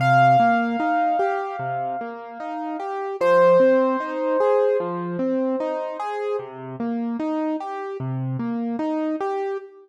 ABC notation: X:1
M:4/4
L:1/8
Q:"Swing 16ths" 1/4=75
K:Cm
V:1 name="Acoustic Grand Piano"
f8 | c8 | z8 |]
V:2 name="Acoustic Grand Piano"
C, B, E G C, B, E G | F, C E A F, C E A | C, B, E G C, B, E G |]